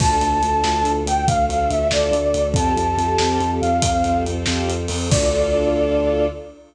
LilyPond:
<<
  \new Staff \with { instrumentName = "Flute" } { \time 6/8 \key d \minor \tempo 4. = 94 a''2~ a''8 g''8 | f''8 f''8 e''8 d''4. | a''2~ a''8 f''8 | f''4 r2 |
d''2. | }
  \new Staff \with { instrumentName = "String Ensemble 1" } { \time 6/8 \key d \minor <d' f' a'>8 <d' f' a'>16 <d' f' a'>16 <d' f' a'>16 <d' f' a'>4.~ <d' f' a'>16~ | <d' f' a'>8 <d' f' a'>16 <d' f' a'>16 <d' f' a'>16 <d' f' a'>4.~ <d' f' a'>16 | <c' f' g' a'>8 <c' f' g' a'>16 <c' f' g' a'>16 <c' f' g' a'>16 <c' f' g' a'>4.~ <c' f' g' a'>16~ | <c' f' g' a'>8 <c' f' g' a'>16 <c' f' g' a'>16 <c' f' g' a'>16 <c' f' g' a'>4.~ <c' f' g' a'>16 |
<d' f' a'>2. | }
  \new Staff \with { instrumentName = "Synth Bass 2" } { \clef bass \time 6/8 \key d \minor d,8 d,8 d,8 d,8 d,8 d,8 | d,8 d,8 d,8 d,8 d,8 d,8 | f,8 f,8 f,8 f,8 f,8 f,8 | f,8 f,8 f,8 f,8 f,8 f,8 |
d,2. | }
  \new Staff \with { instrumentName = "String Ensemble 1" } { \time 6/8 \key d \minor <d' f' a'>2. | <a d' a'>2. | <c' f' g' a'>2. | <c' f' a' c''>2. |
<d' f' a'>2. | }
  \new DrumStaff \with { instrumentName = "Drums" } \drummode { \time 6/8 <cymc bd>8 hh8 hh8 sn8 hh8 hh8 | <hh bd>8 hh8 hh8 sn8 hh8 hh8 | <hh bd>8 hh8 hh8 sn8 hh8 hh8 | <hh bd>8 hh8 hh8 sn8 hh8 hho8 |
<cymc bd>4. r4. | }
>>